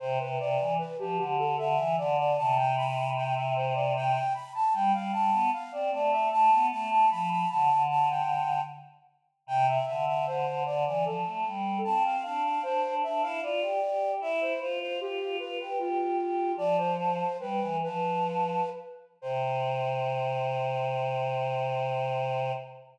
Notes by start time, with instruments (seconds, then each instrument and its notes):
0.00 choir aahs C3, flute C5
0.19 choir aahs C3, flute B4
0.38 choir aahs C3, flute D5
0.60 choir aahs E3
0.78 flute B4
0.99 choir aahs F3, flute G4
1.17 choir aahs D3, flute G4
1.38 flute A4
1.58 choir aahs D3, flute E5
1.77 choir aahs E3
1.98 choir aahs D3, flute D5
2.18 flute D5
2.37 choir aahs C3, flute A5
2.57 flute G5
2.77 flute B5
3.16 flute G5
3.35 flute E5
3.56 flute C5
3.74 flute D5
3.96 flute G5
4.34 flute B5
4.54 flute A5
4.73 choir aahs G3, flute G5
4.93 choir aahs G3, flute F5
5.12 choir aahs G3, flute A5
5.32 choir aahs B3
5.53 flute F5
5.72 choir aahs C4, flute D5
5.92 choir aahs A3, flute D5
6.12 flute E5
6.31 choir aahs A3, flute A5
6.52 choir aahs B3
6.71 choir aahs A3, flute A5
6.91 flute A5
7.11 choir aahs F3, flute B5
7.31 flute B5
7.50 choir aahs D3, flute A5
7.69 choir aahs D3
7.90 flute A5
8.10 flute G5
9.47 choir aahs C3, flute G5
9.68 flute E5
9.86 choir aahs D3, flute E5
10.07 flute E5
10.27 choir aahs D3, flute C5
10.46 choir aahs D3
10.66 choir aahs D3, flute D5
10.86 choir aahs E3, flute D5
11.03 choir aahs F3, flute A4
11.25 choir aahs A3
11.45 choir aahs G3
11.84 choir aahs C4, flute A5
12.05 flute F5
12.23 choir aahs D4, flute F5
12.44 flute F5
12.62 choir aahs D4, flute C5
12.83 choir aahs D4
13.03 choir aahs D4, flute E5
13.21 choir aahs E4, flute F5
13.42 choir aahs F4, flute D5
13.62 choir aahs G4
13.82 choir aahs G4
14.20 choir aahs E4, flute E5
14.41 flute C5
14.60 choir aahs F4, flute C5
14.81 flute C5
15.00 choir aahs F4, flute G4
15.20 choir aahs F4
15.39 choir aahs F4, flute B4
15.59 choir aahs G4, flute B4
15.79 flute F4, choir aahs G4
15.99 choir aahs G4
16.19 choir aahs G4
16.56 choir aahs F3, flute D5
16.77 flute C5
16.97 flute C5
17.39 choir aahs G3, flute B4
17.60 choir aahs E3
17.83 choir aahs F3, flute B4
19.22 choir aahs C3, flute C5